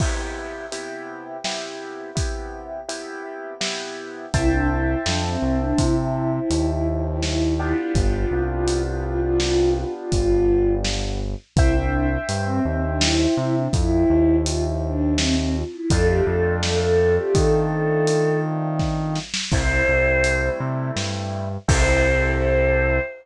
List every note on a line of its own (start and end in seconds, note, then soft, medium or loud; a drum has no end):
0.00 0.66 C3 medium
0.00 0.66 B3 medium
0.00 0.66 E4 medium
0.00 0.66 G4 medium
0.00 kick medium
0.00 crash medium
0.72 1.37 C3 medium
0.72 1.37 B3 medium
0.72 1.37 E4 medium
0.72 1.37 G4 medium
0.72 closed hi-hat medium
1.44 2.10 C3 medium
1.44 2.10 B3 medium
1.44 2.10 E4 medium
1.44 2.10 G4 medium
1.44 snare medium
2.15 2.80 C3 medium
2.15 2.80 B3 medium
2.15 2.80 E4 medium
2.15 2.80 G4 medium
2.15 kick medium
2.15 closed hi-hat medium
2.88 3.53 C3 medium
2.88 3.53 B3 medium
2.88 3.53 E4 medium
2.88 3.53 G4 medium
2.88 closed hi-hat medium
3.61 4.26 C3 medium
3.61 4.26 B3 medium
3.61 4.26 E4 medium
3.61 4.26 G4 medium
3.61 snare loud
4.32 4.95 C2 medium
4.32 4.49 E4 loud
4.32 7.43 C5 medium
4.32 7.43 E5 medium
4.32 7.43 G5 medium
4.32 7.43 A5 medium
4.32 kick medium
4.32 closed hi-hat medium
4.50 4.68 D4 medium
4.68 4.98 E4 medium
5.05 5.37 F2 medium
5.05 5.23 D4 medium
5.05 snare loud
5.23 5.58 C4 medium
5.42 5.73 C2 medium
5.61 5.78 D4 medium
5.78 6.40 C3 medium
5.78 5.95 E4 loud
5.78 kick medium
5.78 closed hi-hat medium
5.98 6.30 E4 medium
6.33 6.67 E4 medium
6.50 7.73 D#2 medium
6.50 closed hi-hat medium
6.69 6.86 E4 medium
6.88 7.04 E4 medium
7.04 7.21 E4 medium
7.22 7.53 E4 medium
7.22 snare medium
7.59 11.21 B3 medium
7.59 11.21 D4 medium
7.59 7.76 E4 medium
7.59 11.21 F4 medium
7.59 11.21 G4 medium
7.77 7.94 E4 medium
7.95 8.25 G1 medium
7.95 8.12 F4 loud
7.95 kick medium
7.95 closed hi-hat medium
8.12 8.42 F4 medium
8.31 9.85 C2 medium
8.50 8.82 F4 medium
8.68 closed hi-hat medium
8.85 9.02 F4 medium
9.02 9.20 F4 medium
9.20 9.38 F4 medium
9.40 9.71 F4 loud
9.40 snare medium
9.76 9.93 F4 loud
9.95 10.12 F4 medium
10.12 11.35 G1 medium
10.12 10.73 F4 loud
10.12 kick medium
10.12 closed hi-hat medium
10.84 snare medium
11.56 12.18 C2 medium
11.56 11.75 E4 loud
11.56 15.49 C5 medium
11.56 15.49 E5 medium
11.56 15.49 G5 medium
11.56 kick loud
11.56 closed hi-hat medium
11.74 12.07 D4 medium
12.29 12.59 G2 medium
12.29 closed hi-hat medium
12.46 12.63 C4 loud
12.65 13.27 D#2 medium
12.65 12.83 C4 medium
12.84 13.01 D4 medium
13.01 13.34 E4 medium
13.01 snare loud
13.37 13.68 C3 medium
13.37 13.55 E4 medium
13.55 13.72 D4 medium
13.72 14.04 F2 medium
13.72 14.36 E4 loud
13.72 kick loud
13.72 closed hi-hat medium
14.10 15.64 D#2 medium
14.46 14.63 F4 medium
14.46 closed hi-hat loud
14.64 14.81 E4 medium
14.84 15.14 D4 medium
15.17 15.35 C4 loud
15.17 snare loud
15.38 15.55 C4 loud
15.55 15.72 F4 loud
15.71 15.88 E4 loud
15.89 16.21 F2 loud
15.89 19.17 A3 medium
15.89 19.17 C4 medium
15.89 19.17 D4 medium
15.89 19.17 F4 medium
15.89 16.07 A4 loud
15.89 kick loud
15.89 closed hi-hat loud
16.07 16.24 G4 loud
16.24 17.19 F2 medium
16.24 16.56 A4 loud
16.62 16.79 A4 medium
16.62 snare loud
16.82 17.16 A4 loud
17.18 17.35 G4 loud
17.34 19.19 D#3 medium
17.34 18.39 A4 loud
17.34 kick medium
17.34 closed hi-hat medium
18.07 closed hi-hat medium
18.79 kick medium
18.79 snare medium
19.16 snare medium
19.34 snare loud
19.52 19.83 C2 medium
19.52 21.48 G3 medium
19.52 21.48 A3 medium
19.52 21.48 C4 medium
19.52 21.48 E4 medium
19.52 20.49 C5 loud
19.52 kick loud
19.52 crash medium
19.88 20.50 C2 medium
20.24 closed hi-hat medium
20.60 20.91 C3 medium
20.96 21.58 G2 medium
20.96 snare medium
21.68 22.99 C2 loud
21.68 22.98 C4 loud
21.68 22.98 E4 medium
21.68 22.98 G4 medium
21.68 22.98 A4 loud
21.68 23.00 C5 loud
21.68 kick loud
21.68 crash loud